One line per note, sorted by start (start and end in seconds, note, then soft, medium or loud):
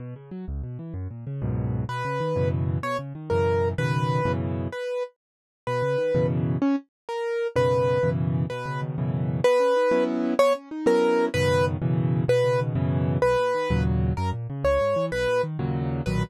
0.00 0.14 B2 loud
0.16 0.30 C#3 medium
0.31 0.45 F#3 medium
0.48 0.62 C#2 medium
0.64 0.78 B2 medium
0.79 0.93 E3 medium
0.94 1.08 F#2 loud
1.10 1.25 A#2 medium
1.27 1.41 C#3 medium
1.42 1.84 C#2 loud
1.42 1.84 F#2 loud
1.42 1.84 G#2 medium
1.42 1.84 B2 loud
1.89 2.03 B2 loud
1.89 2.49 B4 medium
2.05 2.19 C#3 medium
2.20 2.35 D#3 medium
2.36 2.78 F#2 loud
2.36 2.78 B2 medium
2.36 2.78 C#3 loud
2.36 2.78 E3 medium
2.83 2.97 B2 medium
2.83 2.97 C#5 medium
2.99 3.13 C#3 medium
3.15 3.29 D#3 medium
3.30 3.74 F#2 loud
3.30 3.74 B2 medium
3.30 3.74 C#3 medium
3.30 3.74 E3 medium
3.30 3.69 A#4 medium
3.78 4.21 F#2 medium
3.78 4.21 B2 loud
3.78 4.21 C#3 medium
3.78 4.21 D#3 medium
3.78 4.32 B4 loud
4.25 4.68 F#2 loud
4.25 4.68 B2 loud
4.25 4.68 C#3 loud
4.25 4.68 E3 loud
4.72 5.03 B4 medium
5.67 5.81 B2 medium
5.67 6.27 B4 medium
5.82 5.96 C#3 medium
5.98 6.12 D#3 medium
6.14 6.57 F#2 loud
6.14 6.57 B2 loud
6.14 6.57 C#3 loud
6.14 6.57 E3 loud
6.62 6.76 C#4 medium
7.09 7.47 A#4 medium
7.56 7.98 F#2 loud
7.56 7.98 B2 loud
7.56 7.98 C#3 loud
7.56 7.98 D#3 medium
7.56 8.10 B4 loud
8.03 8.46 F#2 medium
8.03 8.46 B2 medium
8.03 8.46 C#3 loud
8.03 8.46 E3 loud
8.50 8.96 B2 loud
8.50 8.81 B4 medium
8.66 8.96 C#3 medium
8.82 8.97 D#3 medium
8.98 9.40 F#2 loud
8.98 9.40 B2 loud
8.98 9.40 C#3 medium
8.98 9.40 E3 loud
9.44 9.59 B3 loud
9.44 10.04 B4 loud
9.60 9.74 C#4 medium
9.76 9.90 D#4 medium
9.91 10.34 F#3 loud
9.91 10.34 B3 loud
9.91 10.34 C#4 loud
9.91 10.34 E4 loud
10.39 10.53 B3 loud
10.39 10.53 C#5 loud
10.55 10.69 C#4 medium
10.71 10.85 D#4 medium
10.86 11.29 F#3 loud
10.86 11.29 B3 loud
10.86 11.29 C#4 loud
10.86 11.29 E4 loud
10.86 11.26 A#4 loud
11.34 11.77 F#2 loud
11.34 11.77 B2 loud
11.34 11.77 C#3 loud
11.34 11.77 D#3 loud
11.34 11.65 B4 loud
11.82 12.24 F#2 loud
11.82 12.24 B2 loud
11.82 12.24 C#3 loud
11.82 12.24 E3 loud
12.28 12.73 B2 loud
12.28 12.60 B4 loud
12.44 12.74 C#3 medium
12.60 12.75 D#3 medium
12.75 13.18 F#2 loud
12.75 13.18 B2 loud
12.75 13.18 C#3 loud
12.75 13.18 E3 loud
13.22 13.36 B1 loud
13.22 13.83 B4 loud
13.39 13.53 A#2 medium
13.55 13.69 D#3 medium
13.70 14.13 D#2 loud
13.70 14.13 A#2 loud
13.70 14.13 C#3 loud
13.70 14.13 F#3 loud
14.17 14.32 F#2 loud
14.17 14.30 A#4 medium
14.33 14.47 A#2 medium
14.50 14.64 C#3 medium
14.64 14.78 C#2 loud
14.64 15.06 C#5 medium
14.81 14.95 G#2 medium
14.96 15.10 E3 medium
15.12 15.26 B1 loud
15.12 15.42 B4 loud
15.27 15.41 A#2 medium
15.43 15.58 D#3 medium
15.59 16.02 D#2 loud
15.59 16.02 A#2 loud
15.59 16.02 C#3 loud
15.59 16.02 F#3 loud
16.06 16.23 B1 loud
16.06 16.23 A#2 loud
16.06 16.23 D#3 loud
16.06 16.23 F#3 loud
16.06 16.22 B4 loud